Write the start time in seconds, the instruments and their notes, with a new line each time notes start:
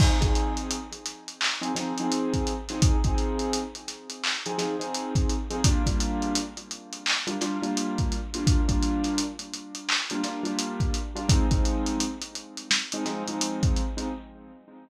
0.00 acoustic grand piano F3 C4 D#4 G#4, kick, crash
0.21 acoustic grand piano F3 C4 D#4 G#4, kick, snare, closed hi-hat
0.35 closed hi-hat
0.57 closed hi-hat
0.71 closed hi-hat
0.92 closed hi-hat
1.06 snare, closed hi-hat
1.28 closed hi-hat
1.41 clap
1.61 acoustic grand piano F3 C4 D#4 G#4, closed hi-hat
1.75 acoustic grand piano F3 C4 D#4 G#4, snare, closed hi-hat
1.98 acoustic grand piano F3 C4 D#4 G#4, closed hi-hat
2.12 closed hi-hat
2.34 kick, closed hi-hat
2.47 closed hi-hat
2.69 acoustic grand piano F3 C4 D#4 G#4, snare, closed hi-hat
2.82 kick, closed hi-hat
3.04 acoustic grand piano F3 C4 D#4 G#4, kick, closed hi-hat
3.18 closed hi-hat
3.39 closed hi-hat
3.53 closed hi-hat
3.75 closed hi-hat
3.88 snare, closed hi-hat
4.10 closed hi-hat
4.24 clap
4.46 acoustic grand piano F3 C4 D#4 G#4, closed hi-hat
4.58 acoustic grand piano F3 C4 D#4 G#4, snare, closed hi-hat
4.80 acoustic grand piano F3 C4 D#4 G#4, closed hi-hat
4.95 closed hi-hat
5.15 kick, closed hi-hat
5.30 closed hi-hat
5.50 acoustic grand piano F3 C4 D#4 G#4, closed hi-hat
5.64 acoustic grand piano G3 A#3 D4 F4, kick, closed hi-hat
5.86 acoustic grand piano G3 A#3 D4 F4, kick, closed hi-hat
6.00 closed hi-hat
6.22 closed hi-hat
6.35 closed hi-hat
6.57 closed hi-hat
6.71 closed hi-hat
6.93 closed hi-hat
7.06 clap
7.27 acoustic grand piano G3 A#3 D4 F4, closed hi-hat
7.41 acoustic grand piano G3 A#3 D4 F4, snare, closed hi-hat
7.62 acoustic grand piano G3 A#3 D4 F4, closed hi-hat
7.77 closed hi-hat
7.98 kick, closed hi-hat
8.12 closed hi-hat
8.34 acoustic grand piano G3 A#3 D4 F4, closed hi-hat
8.47 kick, closed hi-hat
8.68 acoustic grand piano G3 A#3 D4 F4, kick, closed hi-hat
8.82 closed hi-hat
9.04 snare, closed hi-hat
9.18 closed hi-hat
9.39 closed hi-hat
9.54 closed hi-hat
9.75 closed hi-hat
9.89 clap
10.10 acoustic grand piano G3 A#3 D4 F4, closed hi-hat
10.24 acoustic grand piano G3 A#3 D4 F4, snare, closed hi-hat
10.43 acoustic grand piano G3 A#3 D4 F4, closed hi-hat
10.59 closed hi-hat
10.80 kick, closed hi-hat
10.94 closed hi-hat
11.15 acoustic grand piano G3 A#3 D4 F4, closed hi-hat
11.28 acoustic grand piano F3 G#3 C4 D#4, kick, closed hi-hat
11.51 acoustic grand piano F3 G#3 C4 D#4, kick, closed hi-hat
11.65 closed hi-hat
11.86 closed hi-hat
12.00 closed hi-hat
12.22 closed hi-hat
12.35 closed hi-hat
12.57 closed hi-hat
12.71 snare
12.92 acoustic grand piano F3 G#3 C4 D#4, closed hi-hat
13.05 acoustic grand piano F3 G#3 C4 D#4, snare, closed hi-hat
13.27 acoustic grand piano F3 G#3 C4 D#4, closed hi-hat
13.41 closed hi-hat
13.63 kick, closed hi-hat
13.76 closed hi-hat
13.97 acoustic grand piano F3 G#3 C4 D#4, closed hi-hat